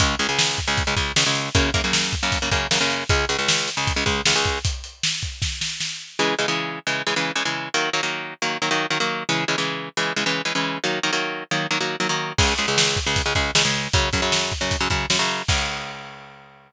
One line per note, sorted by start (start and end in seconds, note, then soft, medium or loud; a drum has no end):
0.00 0.15 C#2 loud
0.00 0.15 C#3 loud
0.00 0.15 G#3 loud
0.00 kick loud
0.00 closed hi-hat loud
0.19 0.27 C#2 loud
0.19 0.27 C#3 medium
0.19 0.27 G#3 loud
0.19 closed hi-hat medium
0.29 0.60 C#2 medium
0.29 0.60 C#3 loud
0.29 0.60 G#3 loud
0.39 snare loud
0.58 kick medium
0.58 closed hi-hat medium
0.68 0.83 C#2 loud
0.68 0.83 C#3 loud
0.68 0.83 G#3 medium
0.78 kick loud
0.78 closed hi-hat medium
0.87 0.95 C#2 medium
0.87 0.95 C#3 loud
0.87 0.95 G#3 loud
0.97 1.12 C#2 medium
0.97 1.12 C#3 medium
0.97 1.12 G#3 medium
0.97 kick medium
0.97 closed hi-hat medium
1.16 1.24 C#2 loud
1.16 1.24 C#3 loud
1.16 1.24 G#3 loud
1.16 snare loud
1.26 1.49 C#2 medium
1.26 1.49 C#3 loud
1.26 1.49 G#3 medium
1.35 closed hi-hat medium
1.55 1.70 F#2 loud
1.55 1.70 C#3 loud
1.55 1.70 A#3 loud
1.55 kick loud
1.55 closed hi-hat loud
1.74 1.82 F#2 loud
1.74 1.82 C#3 loud
1.74 1.82 A#3 loud
1.74 kick loud
1.74 closed hi-hat medium
1.84 2.15 F#2 medium
1.84 2.15 C#3 medium
1.84 2.15 A#3 loud
1.93 snare loud
2.13 kick medium
2.13 closed hi-hat medium
2.23 2.38 F#2 loud
2.23 2.38 C#3 medium
2.23 2.38 A#3 loud
2.32 kick medium
2.32 closed hi-hat loud
2.42 2.50 F#2 medium
2.42 2.50 C#3 loud
2.42 2.50 A#3 medium
2.51 2.67 F#2 loud
2.51 2.67 C#3 loud
2.51 2.67 A#3 loud
2.51 kick medium
2.51 closed hi-hat medium
2.71 2.79 F#2 loud
2.71 2.79 C#3 loud
2.71 2.79 A#3 loud
2.71 snare loud
2.80 3.04 F#2 loud
2.80 3.04 C#3 loud
2.80 3.04 A#3 loud
2.90 closed hi-hat medium
3.09 3.25 C#2 loud
3.09 3.25 C#3 loud
3.09 3.25 G#3 loud
3.09 kick loud
3.09 closed hi-hat loud
3.29 3.37 C#2 loud
3.29 3.37 C#3 medium
3.29 3.37 G#3 loud
3.29 closed hi-hat medium
3.39 3.70 C#2 medium
3.39 3.70 C#3 medium
3.39 3.70 G#3 medium
3.48 snare loud
3.68 closed hi-hat medium
3.77 3.93 C#2 medium
3.77 3.93 C#3 loud
3.77 3.93 G#3 medium
3.87 kick loud
3.87 closed hi-hat loud
3.96 4.04 C#2 loud
3.96 4.04 C#3 medium
3.96 4.04 G#3 medium
4.06 4.21 C#2 medium
4.06 4.21 C#3 loud
4.06 4.21 G#3 loud
4.06 kick medium
4.06 closed hi-hat medium
4.25 4.34 C#2 medium
4.25 4.34 C#3 loud
4.25 4.34 G#3 medium
4.25 snare loud
4.36 4.59 C#2 loud
4.36 4.59 C#3 loud
4.36 4.59 G#3 loud
4.45 kick medium
4.45 closed hi-hat medium
4.65 kick loud
4.65 closed hi-hat loud
4.84 closed hi-hat medium
5.03 snare loud
5.22 kick medium
5.22 closed hi-hat medium
5.42 kick medium
5.42 snare medium
5.61 snare medium
5.80 snare medium
6.19 6.35 C#3 loud
6.19 6.35 E3 loud
6.19 6.35 G#3 loud
6.39 6.46 C#3 loud
6.39 6.46 E3 loud
6.39 6.46 G#3 loud
6.48 6.79 C#3 loud
6.48 6.79 E3 medium
6.48 6.79 G#3 loud
6.87 7.02 C#3 loud
6.87 7.02 E3 loud
6.87 7.02 G#3 loud
7.07 7.14 C#3 medium
7.07 7.14 E3 loud
7.07 7.14 G#3 medium
7.16 7.32 C#3 medium
7.16 7.32 E3 loud
7.16 7.32 G#3 loud
7.35 7.43 C#3 loud
7.35 7.43 E3 medium
7.35 7.43 G#3 loud
7.45 7.69 C#3 medium
7.45 7.69 E3 medium
7.45 7.69 G#3 medium
7.74 7.90 D#3 loud
7.74 7.90 F#3 loud
7.74 7.90 A#3 loud
7.93 8.01 D#3 loud
7.93 8.01 F#3 loud
7.93 8.01 A#3 medium
8.03 8.34 D#3 medium
8.03 8.34 F#3 medium
8.03 8.34 A#3 medium
8.42 8.58 D#3 loud
8.42 8.58 F#3 medium
8.42 8.58 A#3 medium
8.62 8.70 D#3 loud
8.62 8.70 F#3 medium
8.62 8.70 A#3 loud
8.71 8.86 D#3 loud
8.71 8.86 F#3 loud
8.71 8.86 A#3 medium
8.90 8.98 D#3 loud
8.90 8.98 F#3 medium
8.90 8.98 A#3 medium
9.00 9.23 D#3 medium
9.00 9.23 F#3 loud
9.00 9.23 A#3 loud
9.29 9.44 C#3 loud
9.29 9.44 E3 loud
9.29 9.44 G#3 loud
9.48 9.56 C#3 loud
9.48 9.56 E3 medium
9.48 9.56 G#3 loud
9.58 9.89 C#3 loud
9.58 9.89 E3 loud
9.58 9.89 G#3 medium
9.97 10.13 C#3 medium
9.97 10.13 E3 loud
9.97 10.13 G#3 medium
10.16 10.24 C#3 loud
10.16 10.24 E3 medium
10.16 10.24 G#3 loud
10.26 10.42 C#3 loud
10.26 10.42 E3 loud
10.26 10.42 G#3 medium
10.45 10.53 C#3 medium
10.45 10.53 E3 medium
10.45 10.53 G#3 medium
10.55 10.78 C#3 loud
10.55 10.78 E3 loud
10.55 10.78 G#3 medium
10.84 10.99 D#3 loud
10.84 10.99 F#3 loud
10.84 10.99 A#3 loud
11.03 11.11 D#3 loud
11.03 11.11 F#3 medium
11.03 11.11 A#3 loud
11.13 11.44 D#3 loud
11.13 11.44 F#3 loud
11.13 11.44 A#3 loud
11.51 11.67 D#3 loud
11.51 11.67 F#3 medium
11.51 11.67 A#3 medium
11.71 11.78 D#3 loud
11.71 11.78 F#3 loud
11.71 11.78 A#3 loud
11.80 11.96 D#3 medium
11.80 11.96 F#3 medium
11.80 11.96 A#3 loud
12.00 12.08 D#3 medium
12.00 12.08 F#3 loud
12.00 12.08 A#3 medium
12.09 12.33 D#3 loud
12.09 12.33 F#3 medium
12.09 12.33 A#3 medium
12.38 12.54 C#2 loud
12.38 12.54 C#3 loud
12.38 12.54 G#3 loud
12.38 kick loud
12.38 crash loud
12.58 12.66 C#2 medium
12.58 12.66 C#3 medium
12.58 12.66 G#3 loud
12.58 closed hi-hat medium
12.68 12.99 C#2 loud
12.68 12.99 C#3 loud
12.68 12.99 G#3 loud
12.78 snare loud
12.96 kick medium
12.96 closed hi-hat medium
13.06 13.22 C#2 loud
13.06 13.22 C#3 medium
13.06 13.22 G#3 medium
13.16 kick medium
13.16 closed hi-hat loud
13.26 13.33 C#2 medium
13.26 13.33 C#3 medium
13.26 13.33 G#3 loud
13.35 13.51 C#2 medium
13.35 13.51 C#3 loud
13.35 13.51 G#3 loud
13.35 kick medium
13.35 closed hi-hat medium
13.55 13.63 C#2 loud
13.55 13.63 C#3 loud
13.55 13.63 G#3 loud
13.55 snare loud
13.65 13.88 C#2 loud
13.65 13.88 C#3 medium
13.65 13.88 G#3 medium
13.74 closed hi-hat medium
13.93 14.09 F#2 loud
13.93 14.09 C#3 loud
13.93 14.09 F#3 loud
13.93 kick loud
13.93 closed hi-hat loud
14.13 14.21 F#2 loud
14.13 14.21 C#3 loud
14.13 14.21 F#3 loud
14.13 kick medium
14.13 closed hi-hat medium
14.22 14.53 F#2 medium
14.22 14.53 C#3 loud
14.22 14.53 F#3 loud
14.32 snare loud
14.52 kick medium
14.52 closed hi-hat medium
14.61 14.76 F#2 loud
14.61 14.76 C#3 medium
14.61 14.76 F#3 medium
14.71 kick medium
14.71 closed hi-hat loud
14.80 14.88 F#2 medium
14.80 14.88 C#3 loud
14.80 14.88 F#3 loud
14.90 15.06 F#2 medium
14.90 15.06 C#3 loud
14.90 15.06 F#3 medium
14.90 kick medium
14.90 closed hi-hat medium
15.10 15.18 F#2 loud
15.10 15.18 C#3 medium
15.10 15.18 F#3 medium
15.10 snare loud
15.19 15.42 F#2 loud
15.19 15.42 C#3 loud
15.19 15.42 F#3 medium
15.29 closed hi-hat medium
15.48 16.72 C#2 loud
15.48 16.72 C#3 medium
15.48 16.72 G#3 medium
15.48 kick loud
15.48 crash loud